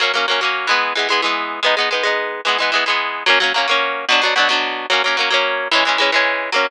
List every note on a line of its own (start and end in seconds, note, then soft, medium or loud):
0.00 0.12 F#3 loud
0.00 0.12 A#3 loud
0.00 0.12 C#4 medium
0.14 0.26 F#3 medium
0.14 0.26 A#3 medium
0.14 0.26 C#4 medium
0.28 0.40 F#3 medium
0.28 0.40 A#3 medium
0.28 0.40 C#4 medium
0.41 0.67 F#3 medium
0.41 0.67 A#3 medium
0.41 0.67 C#4 medium
0.67 0.93 E3 loud
0.67 0.93 G#3 medium
0.67 0.93 B3 loud
0.95 1.08 E3 medium
0.95 1.08 G#3 medium
0.95 1.08 B3 medium
1.09 1.21 E3 medium
1.09 1.21 G#3 loud
1.09 1.21 B3 medium
1.22 1.60 E3 medium
1.22 1.60 G#3 medium
1.22 1.60 B3 medium
1.63 1.75 G#3 loud
1.63 1.75 B3 medium
1.63 1.75 D#4 medium
1.77 1.89 G#3 medium
1.77 1.89 B3 medium
1.77 1.89 D#4 medium
1.91 2.03 G#3 medium
1.91 2.03 B3 medium
1.91 2.03 D#4 medium
2.03 2.41 G#3 medium
2.03 2.41 B3 medium
2.03 2.41 D#4 medium
2.45 2.57 E3 medium
2.45 2.57 G#3 medium
2.45 2.57 B3 medium
2.58 2.71 E3 medium
2.58 2.71 G#3 medium
2.58 2.71 B3 medium
2.72 2.84 E3 medium
2.72 2.84 G#3 medium
2.72 2.84 B3 medium
2.86 3.24 E3 medium
2.86 3.24 G#3 medium
2.86 3.24 B3 medium
3.26 3.39 F#3 loud
3.26 3.39 A#3 loud
3.26 3.39 C#4 loud
3.40 3.53 F#3 loud
3.40 3.53 A#3 medium
3.40 3.53 C#4 loud
3.54 3.67 F#3 medium
3.54 3.67 A#3 loud
3.54 3.67 C#4 medium
3.68 4.05 F#3 medium
3.68 4.05 A#3 medium
3.68 4.05 C#4 medium
4.09 4.21 B2 loud
4.09 4.21 F#3 loud
4.09 4.21 D4 loud
4.22 4.34 B2 medium
4.22 4.34 F#3 loud
4.22 4.34 D4 medium
4.36 4.48 B2 medium
4.36 4.48 F#3 loud
4.36 4.48 D4 medium
4.49 4.86 B2 loud
4.49 4.86 F#3 medium
4.49 4.86 D4 medium
4.90 5.02 F#3 loud
4.90 5.02 A#3 medium
4.90 5.02 C#4 medium
5.04 5.16 F#3 medium
5.04 5.17 A#3 loud
5.04 5.17 C#4 medium
5.17 5.29 F#3 medium
5.17 5.29 A#3 medium
5.17 5.29 C#4 medium
5.30 5.68 F#3 loud
5.30 5.68 A#3 medium
5.30 5.68 C#4 loud
5.71 5.84 E3 loud
5.71 5.84 G#3 loud
5.71 5.84 C#4 loud
5.85 5.98 E3 medium
5.85 5.98 G#3 medium
5.85 5.98 C#4 medium
5.98 6.11 E3 medium
5.98 6.11 G#3 medium
5.98 6.11 C#4 medium
6.12 6.50 E3 medium
6.12 6.50 G#3 medium
6.12 6.50 C#4 loud
6.52 6.67 F#3 loud
6.52 6.67 A#3 medium
6.52 6.67 C#4 loud